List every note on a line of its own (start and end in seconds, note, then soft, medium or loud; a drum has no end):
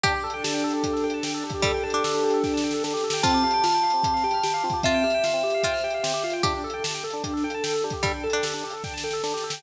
0.04 0.83 D4 loud
0.04 0.13 D4 loud
0.04 1.07 G4 loud
0.04 kick loud
0.04 closed hi-hat medium
0.14 0.23 G4 medium
0.24 0.33 A4 medium
0.24 0.63 A4 medium
0.30 0.43 G5 loud
0.30 closed hi-hat medium
0.44 1.43 G4 medium
0.44 0.53 A5 loud
0.44 snare loud
0.54 0.63 G5 medium
0.64 1.03 A4 medium
0.64 0.73 A4 loud
0.71 0.82 D4 medium
0.71 closed hi-hat medium
0.84 1.63 D4 loud
0.84 0.93 G4 medium
0.84 kick medium
0.84 closed hi-hat medium
0.93 1.02 A4 medium
0.93 snare medium
1.04 1.23 A4 medium
1.04 1.13 G5 medium
1.10 1.23 A5 medium
1.10 closed hi-hat medium
1.23 1.83 A4 medium
1.23 1.33 G5 medium
1.23 snare loud
1.34 1.43 A4 medium
1.44 1.53 D4 medium
1.44 2.03 G4 medium
1.50 kick medium
1.50 closed hi-hat medium
1.54 1.63 G4 medium
1.62 1.72 G3 medium
1.62 2.43 D4 loud
1.62 1.73 A4 medium
1.62 kick loud
1.62 closed hi-hat medium
1.74 1.83 G5 medium
1.83 2.23 A4 medium
1.83 1.92 A5 medium
1.90 2.38 D4 medium
1.90 2.03 G5 medium
1.90 closed hi-hat medium
2.04 3.03 G4 medium
2.04 2.13 A4 medium
2.04 snare loud
2.14 2.23 D4 medium
2.24 2.33 G4 medium
2.24 2.63 A4 medium
2.30 2.43 A4 medium
2.30 closed hi-hat medium
2.44 3.20 D4 medium
2.44 2.53 G5 medium
2.44 kick medium
2.44 snare medium
2.54 2.62 A5 medium
2.54 snare medium
2.64 2.83 A4 medium
2.64 2.73 G5 medium
2.71 2.83 A4 medium
2.71 snare medium
2.84 2.93 D4 loud
2.84 3.22 A4 medium
2.84 snare medium
2.94 3.03 G4 medium
2.94 snare medium
3.04 3.23 G4 medium
3.04 3.13 A4 medium
3.10 3.22 G5 medium
3.10 snare loud
3.23 3.32 C4 loud
3.23 3.44 C4 loud
3.23 4.39 F4 medium
3.23 4.79 A5 medium
3.23 kick loud
3.23 closed hi-hat medium
3.34 3.43 G4 medium
3.43 3.64 G4 medium
3.43 3.52 F5 medium
3.51 3.62 G5 medium
3.51 closed hi-hat medium
3.64 3.84 F4 medium
3.64 3.73 F6 loud
3.64 snare medium
3.74 3.83 G5 medium
3.83 4.04 G4 medium
3.83 3.92 F5 medium
3.90 4.02 C4 medium
3.90 closed hi-hat medium
4.04 4.24 C4 medium
4.04 4.13 G4 medium
4.04 kick medium
4.04 closed hi-hat medium
4.14 4.23 F5 medium
4.14 snare soft
4.24 4.43 G4 loud
4.24 4.33 G5 medium
4.31 4.42 F6 medium
4.31 closed hi-hat medium
4.43 4.64 G4 medium
4.43 4.52 G5 medium
4.43 snare medium
4.54 4.63 F5 medium
4.64 4.73 C4 medium
4.64 4.84 F4 medium
4.70 4.82 G4 medium
4.70 kick medium
4.70 closed hi-hat medium
4.83 5.04 C4 loud
4.83 5.05 F4 loud
4.83 6.33 E5 medium
4.83 4.93 F5 medium
4.83 kick medium
4.83 closed hi-hat medium
4.94 5.03 G5 medium
5.04 5.24 G4 medium
5.04 5.13 F6 medium
5.10 closed hi-hat medium
5.14 5.23 G5 medium
5.24 5.44 F4 medium
5.24 5.33 F5 medium
5.24 snare medium
5.33 5.43 C4 medium
5.43 5.52 G4 medium
5.43 5.64 G4 medium
5.50 closed hi-hat medium
5.54 5.63 F5 medium
5.63 5.84 C4 medium
5.63 5.81 F4 medium
5.63 5.73 G5 loud
5.63 kick medium
5.63 closed hi-hat medium
5.73 5.82 F6 medium
5.73 snare medium
5.84 6.03 G4 medium
5.84 5.93 G5 medium
5.90 6.03 F5 medium
5.90 closed hi-hat medium
6.03 6.12 C4 medium
6.03 6.24 G4 medium
6.03 snare loud
6.14 6.23 G4 medium
6.24 6.43 F4 medium
6.24 6.33 F5 medium
6.30 6.42 G5 medium
6.30 closed hi-hat medium
6.43 6.64 D4 loud
6.43 6.53 D4 loud
6.43 7.46 G4 loud
6.43 kick loud
6.43 closed hi-hat medium
6.54 6.63 G4 medium
6.64 6.84 A4 medium
6.64 6.73 A4 medium
6.70 6.83 G5 loud
6.70 closed hi-hat medium
6.84 7.04 G4 medium
6.84 6.93 A5 loud
6.84 snare loud
6.94 7.03 G5 medium
7.04 7.24 A4 medium
7.04 7.13 A4 loud
7.10 7.22 D4 medium
7.10 closed hi-hat medium
7.24 7.44 D4 loud
7.24 7.33 G4 medium
7.24 kick medium
7.24 closed hi-hat medium
7.33 7.42 A4 medium
7.33 snare medium
7.44 7.63 A4 medium
7.44 7.53 G5 medium
7.50 closed hi-hat medium
7.54 7.63 A5 medium
7.64 7.84 A4 medium
7.64 7.73 G5 medium
7.64 snare loud
7.74 7.83 A4 medium
7.84 7.93 D4 medium
7.84 8.04 G4 medium
7.90 8.02 G4 medium
7.90 kick medium
7.90 closed hi-hat medium
8.03 8.12 G3 medium
8.03 8.24 D4 loud
8.03 8.13 A4 medium
8.03 kick loud
8.03 closed hi-hat medium
8.14 8.23 G5 medium
8.23 8.44 A4 medium
8.23 8.32 A5 medium
8.30 8.77 D4 medium
8.30 8.43 G5 medium
8.30 closed hi-hat medium
8.43 8.64 G4 medium
8.43 8.53 A4 medium
8.43 snare loud
8.54 8.63 D4 medium
8.64 8.73 G4 medium
8.64 8.84 A4 medium
8.70 8.82 A4 medium
8.70 closed hi-hat medium
8.84 9.04 D4 medium
8.84 8.93 G5 medium
8.84 kick medium
8.84 snare medium
8.94 9.03 A5 medium
8.94 snare medium
9.04 9.23 A4 medium
9.04 9.13 G5 medium
9.11 9.22 A4 medium
9.11 snare medium
9.23 9.32 D4 loud
9.23 9.44 A4 medium
9.23 snare medium
9.34 9.43 G4 medium
9.34 snare medium
9.44 9.63 G4 medium
9.44 9.53 A4 medium
9.50 9.62 G5 medium
9.50 snare loud